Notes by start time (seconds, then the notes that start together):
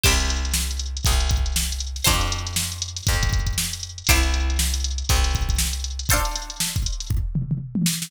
0.03 C2 E4 G4 C5, kick, crash
0.20 closed hi-hat
0.30 closed hi-hat
0.45 closed hi-hat
0.54 snare
0.71 closed hi-hat
0.79 closed hi-hat
0.97 closed hi-hat
1.05 C2, kick, closed hi-hat
1.20 closed hi-hat
1.29 kick, snare, closed hi-hat
1.46 closed hi-hat
1.56 snare
1.72 closed hi-hat
1.80 closed hi-hat
1.96 snare, closed hi-hat
2.04 F2 D4 F4 A4 C5, kick, closed hi-hat
2.21 closed hi-hat
2.32 closed hi-hat
2.47 snare, closed hi-hat
2.56 snare
2.72 closed hi-hat
2.82 closed hi-hat
2.96 snare, closed hi-hat
3.07 F2, kick, closed hi-hat
3.23 kick, closed hi-hat
3.33 kick, closed hi-hat
3.46 kick, closed hi-hat
3.58 snare
3.73 closed hi-hat
3.83 closed hi-hat
3.98 closed hi-hat
4.07 C2 G4 C5, kick, closed hi-hat
4.11 E4
4.23 snare, closed hi-hat
4.34 closed hi-hat
4.50 closed hi-hat
4.59 snare
4.74 closed hi-hat
4.84 closed hi-hat
4.98 closed hi-hat
5.09 C2, kick, closed hi-hat
5.23 snare, closed hi-hat
5.33 kick, snare, closed hi-hat
5.49 kick, closed hi-hat
5.58 snare
5.73 closed hi-hat
5.84 closed hi-hat
5.99 closed hi-hat
6.09 F4 A4 C5, kick, closed hi-hat
6.13 D4
6.25 closed hi-hat
6.35 snare, closed hi-hat
6.50 closed hi-hat
6.60 snare
6.76 kick, closed hi-hat
6.86 closed hi-hat
7.00 snare, closed hi-hat
7.10 kick, floor tom
7.35 mid tom
7.51 mid tom
7.75 high tom
7.86 snare
8.02 snare